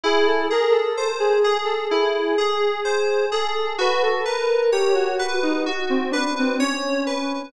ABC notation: X:1
M:4/4
L:1/16
Q:1/4=64
K:Cdor
V:1 name="Lead 1 (square)"
^G A B A2 G2 A G6 A2 | =B A _B2 G ^F2 E F C D ^B, ^C4 |]
V:2 name="Electric Piano 2"
=E2 ^G2 ^B2 G2 E2 G2 B2 G2 | ^F2 =B2 ^c2 B2 F2 B2 c2 B2 |]